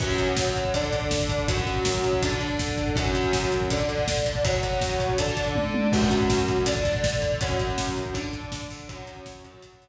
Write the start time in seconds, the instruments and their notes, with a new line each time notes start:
0.00 overdriven guitar F#3 C#4 F#4, kick, crash
0.09 kick
0.18 kick, closed hi-hat
0.28 kick
0.37 kick, snare
0.47 kick
0.55 kick, closed hi-hat
0.65 kick
0.74 overdriven guitar D3 D4 A4, kick, closed hi-hat
0.84 kick
0.93 kick, closed hi-hat
1.02 kick
1.11 kick, snare
1.20 kick
1.29 kick, closed hi-hat
1.39 kick
1.48 overdriven guitar F#3 C#4 F#4, kick, closed hi-hat
1.57 kick
1.67 kick, closed hi-hat
1.76 kick
1.85 kick, snare
1.95 kick
2.04 kick, closed hi-hat
2.13 kick
2.22 overdriven guitar D3 D4 A4, kick, closed hi-hat
2.32 kick
2.41 kick, closed hi-hat
2.50 kick
2.59 kick, snare
2.68 kick
2.78 kick, closed hi-hat
2.87 kick
2.96 overdriven guitar F#3 C#4 F#4, kick, closed hi-hat
3.06 kick
3.15 kick, closed hi-hat
3.24 kick
3.33 kick, snare
3.43 kick
3.52 kick, closed hi-hat
3.61 kick
3.70 overdriven guitar D3 D4 A4, kick, closed hi-hat
3.80 kick
3.89 kick, closed hi-hat
3.98 kick
4.08 kick, snare
4.17 kick
4.26 kick, closed hi-hat
4.35 kick
4.44 overdriven guitar F#3 C#4 F#4, kick, closed hi-hat
4.53 kick
4.63 kick, closed hi-hat
4.73 kick
4.81 kick, snare
4.90 kick
5.00 kick, closed hi-hat
5.09 kick
5.18 overdriven guitar D3 D4 A4, kick, closed hi-hat
5.28 kick
5.37 kick, closed hi-hat
5.46 kick
5.55 kick, high tom
5.74 high tom
5.92 overdriven guitar F#3 C#4 F#4, kick, crash
6.02 kick
6.11 kick, closed hi-hat
6.21 kick
6.30 kick, snare
6.38 kick
6.48 kick, closed hi-hat
6.57 kick
6.66 overdriven guitar D3 D4 A4, kick, closed hi-hat
6.76 kick
6.85 kick, closed hi-hat
6.95 kick
7.04 kick, snare
7.13 kick
7.22 kick, closed hi-hat
7.32 kick
7.41 overdriven guitar F#3 C#4 F#4, kick, closed hi-hat
7.50 kick
7.59 kick, closed hi-hat
7.68 kick
7.77 kick, snare
7.87 kick
7.96 kick, closed hi-hat
8.06 kick
8.14 overdriven guitar D3 D4 A4, kick, closed hi-hat
8.24 kick
8.33 kick, closed hi-hat
8.43 kick
8.52 kick, snare
8.62 kick
8.70 kick, open hi-hat
8.80 kick
8.89 overdriven guitar F#3 C#4 F#4, kick, closed hi-hat
8.98 kick
9.07 kick, closed hi-hat
9.17 kick
9.26 kick, snare
9.35 kick
9.44 overdriven guitar F#3 C#4 F#4, kick, closed hi-hat
9.54 kick
9.62 kick, closed hi-hat
9.73 kick
9.82 kick, closed hi-hat